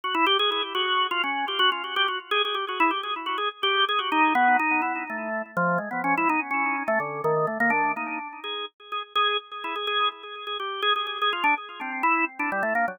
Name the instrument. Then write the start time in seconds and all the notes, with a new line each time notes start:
drawbar organ
0.04 F#4
0.14 E4
0.27 G4
0.39 G#4
0.52 G#4
0.75 F#4
1.11 F4
1.24 C#4
1.48 G4
1.59 F#4
1.72 F4
1.84 F#4
1.96 G4
2.08 F#4
2.31 G#4
2.45 G#4
2.54 G4
2.69 F#4
2.80 E4
2.91 G4
3.03 G#4
3.26 F#4
3.38 G#4
3.63 G4
3.89 G#4
3.99 F#4
4.12 D#4
4.35 B3
4.59 D#4
4.82 E4
5.10 A3
5.57 F3
5.78 G#3
5.91 B3
6.04 C#4
6.17 E4
6.29 D#4
6.51 C#4
6.88 A3
7.00 D3
7.24 D#3
7.47 A3
7.60 A#3
7.70 D4
7.97 D#4
8.44 G#4
8.92 G#4
9.15 G#4
9.64 E4
9.76 G#4
9.87 G#4
10.47 G#4
10.60 G4
10.82 G#4
10.96 G#4
11.07 G#4
11.22 G#4
11.33 F4
11.44 D4
11.81 C4
12.03 E4
12.39 D4
12.52 G3
12.63 A3
12.75 A#3
12.88 F#3